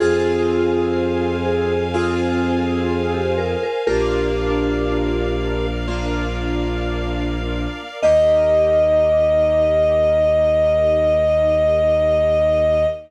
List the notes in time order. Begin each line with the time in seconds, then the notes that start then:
0.00 F2 C4 F4 G#4 C5 F5 G#5
1.45 G#4
1.94 C4 F4 G#4
3.14 G4
3.38 A#4
3.63 A#4
3.87 A#1 A#3 D4 F4 G4 A#4 D5 F5
5.88 A#3 D4 F4
8.02 D#2 A#3 D#4 G4 D#5